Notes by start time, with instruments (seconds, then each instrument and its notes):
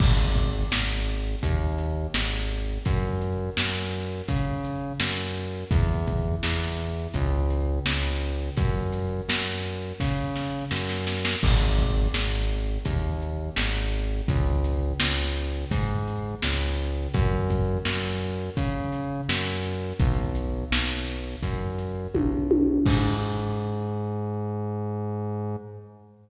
0.00 synth bass 1 G#1, kick, crash
0.35 kick, closed hi-hat
0.71 synth bass 1 G#1, snare
1.07 closed hi-hat
1.43 synth bass 1 D#2, kick, closed hi-hat
1.78 closed hi-hat
2.14 synth bass 1 G#1, snare
2.50 closed hi-hat
2.85 synth bass 1 F#2, kick, closed hi-hat
3.21 closed hi-hat
3.57 synth bass 1 F#2, snare
3.93 closed hi-hat
4.28 synth bass 1 C#3, kick, closed hi-hat
4.64 closed hi-hat
5.00 synth bass 1 F#2, snare
5.35 closed hi-hat
5.71 synth bass 1 E2, kick, closed hi-hat
6.07 kick, closed hi-hat
6.43 synth bass 1 E2, snare
6.79 closed hi-hat
7.14 synth bass 1 C#2, kick, closed hi-hat
7.50 closed hi-hat
7.86 synth bass 1 C#2, snare
8.21 closed hi-hat
8.57 synth bass 1 F#2, kick, closed hi-hat
8.93 closed hi-hat
9.29 synth bass 1 F#2, snare
9.65 closed hi-hat
10.00 synth bass 1 C#3, kick, snare
10.36 snare
10.71 synth bass 1 F#2, snare
10.89 snare
11.07 snare
11.25 snare
11.43 synth bass 1 G#1, kick, crash
11.78 kick, closed hi-hat
12.14 synth bass 1 G#1, snare
12.49 closed hi-hat
12.85 synth bass 1 D#2, kick, closed hi-hat
13.22 closed hi-hat
13.56 synth bass 1 G#1, snare
13.93 closed hi-hat
14.28 synth bass 1 C#2, kick, closed hi-hat
14.64 closed hi-hat
15.00 synth bass 1 C#2, snare
15.36 closed hi-hat
15.71 synth bass 1 G#2, kick, closed hi-hat
16.07 closed hi-hat
16.42 synth bass 1 C#2, snare
16.79 closed hi-hat
17.14 synth bass 1 F#2, kick, closed hi-hat
17.50 kick, closed hi-hat
17.85 synth bass 1 F#2, snare
18.21 closed hi-hat
18.57 synth bass 1 C#3, kick, closed hi-hat
18.92 closed hi-hat
19.29 synth bass 1 F#2, snare
19.64 closed hi-hat
20.00 synth bass 1 B1, kick, closed hi-hat
20.35 closed hi-hat
20.71 synth bass 1 B1, snare
21.08 closed hi-hat
21.43 synth bass 1 F#2, kick, closed hi-hat
21.78 closed hi-hat
22.15 synth bass 1 B1, kick, high tom
22.51 high tom
22.86 synth bass 1 G#2, kick, crash